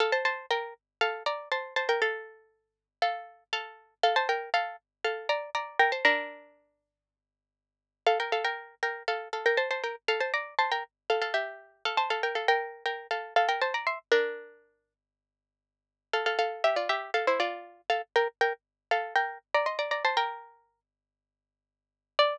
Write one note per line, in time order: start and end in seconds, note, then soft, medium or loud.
0.00 0.12 A4 medium
0.00 0.12 F5 medium
0.12 0.24 C5 medium
0.12 0.24 A5 medium
0.25 0.46 C5 medium
0.25 0.46 A5 medium
0.51 0.74 A#4 medium
0.51 0.74 G5 medium
1.01 1.23 A4 medium
1.01 1.23 F5 medium
1.26 1.49 D5 medium
1.26 1.49 A#5 medium
1.52 1.74 C5 medium
1.52 1.74 A5 medium
1.76 1.88 C5 medium
1.76 1.88 A5 medium
1.89 2.01 A#4 medium
1.89 2.01 G5 medium
2.02 2.87 A4 medium
2.02 2.87 F5 medium
3.02 3.44 A4 medium
3.02 3.44 F5 medium
3.53 3.94 A4 medium
3.53 3.94 F5 medium
4.03 4.15 A4 medium
4.03 4.15 F5 medium
4.16 4.28 C5 medium
4.16 4.28 A5 medium
4.29 4.50 A#4 medium
4.29 4.50 G5 medium
4.54 4.76 A4 medium
4.54 4.76 F5 medium
5.04 5.28 A4 medium
5.04 5.28 F5 medium
5.29 5.50 D5 medium
5.29 5.50 A#5 medium
5.55 5.78 D5 medium
5.55 5.78 A#5 medium
5.79 5.91 A#4 medium
5.79 5.91 G5 medium
5.92 6.04 C5 medium
5.92 6.04 A5 medium
6.05 7.20 D4 medium
6.05 7.20 A#4 medium
8.07 8.18 A4 medium
8.07 8.18 F5 medium
8.20 8.32 A#4 soft
8.20 8.32 G5 medium
8.32 8.44 A4 medium
8.32 8.44 F5 medium
8.44 8.75 A#4 medium
8.44 8.75 G5 medium
8.83 9.03 A#4 medium
8.83 9.03 G5 medium
9.08 9.28 A4 medium
9.08 9.28 F5 medium
9.33 9.45 A4 medium
9.33 9.45 F5 medium
9.46 9.58 A#4 medium
9.46 9.58 G5 medium
9.57 9.69 C5 medium
9.57 9.69 A5 medium
9.71 9.83 C5 medium
9.71 9.83 A5 medium
9.84 9.95 A#4 medium
9.84 9.95 G5 medium
10.08 10.20 A4 medium
10.08 10.20 F5 medium
10.20 10.32 C5 medium
10.20 10.32 A5 medium
10.34 10.54 D5 medium
10.34 10.54 A#5 medium
10.59 10.71 C5 medium
10.59 10.71 A5 medium
10.72 10.84 A#4 medium
10.72 10.84 G5 medium
11.10 11.21 A4 medium
11.10 11.21 F5 medium
11.22 11.34 A4 medium
11.22 11.34 F5 medium
11.34 11.83 G4 medium
11.34 11.83 E5 medium
11.85 11.97 A4 medium
11.85 11.97 F5 medium
11.97 12.09 C5 medium
11.97 12.09 A5 medium
12.10 12.22 A4 medium
12.10 12.22 F5 medium
12.23 12.35 A#4 medium
12.23 12.35 G5 medium
12.35 12.47 A4 soft
12.35 12.47 F5 medium
12.48 12.84 A#4 medium
12.48 12.84 G5 medium
12.86 13.07 A#4 soft
12.86 13.07 G5 medium
13.11 13.34 A4 soft
13.11 13.34 F5 medium
13.36 13.48 A4 medium
13.36 13.48 F5 medium
13.49 13.61 A#4 medium
13.49 13.61 G5 medium
13.61 13.73 C5 medium
13.61 13.73 A5 medium
13.74 13.86 D5 soft
13.74 13.86 A#5 medium
13.87 13.99 E5 medium
13.87 13.99 C6 medium
14.12 14.93 D4 medium
14.12 14.93 A#4 medium
16.13 16.25 A4 medium
16.13 16.25 F5 medium
16.26 16.38 A4 medium
16.26 16.38 F5 medium
16.39 16.63 A4 medium
16.39 16.63 F5 medium
16.64 16.76 G4 medium
16.64 16.76 E5 medium
16.76 16.88 F4 medium
16.76 16.88 D5 medium
16.89 17.11 G4 medium
16.89 17.11 E5 medium
17.14 17.26 A4 medium
17.14 17.26 F5 medium
17.27 17.39 E4 medium
17.27 17.39 C5 medium
17.40 17.81 F4 medium
17.40 17.81 D5 medium
17.90 18.02 A4 medium
17.90 18.02 F5 medium
18.16 18.28 A#4 medium
18.16 18.28 G5 medium
18.41 18.53 A#4 medium
18.41 18.53 G5 medium
18.91 19.14 A4 medium
18.91 19.14 F5 medium
19.16 19.38 A#4 medium
19.16 19.38 G5 medium
19.54 19.66 D5 medium
19.54 19.66 A#5 medium
19.66 19.78 D#5 soft
19.66 19.78 C6 medium
19.79 19.91 D5 medium
19.79 19.91 A#5 medium
19.91 20.03 D5 medium
19.91 20.03 A#5 medium
20.05 20.16 C5 medium
20.05 20.16 A5 medium
20.17 20.80 A#4 medium
20.17 20.80 G5 medium
22.19 22.37 D5 loud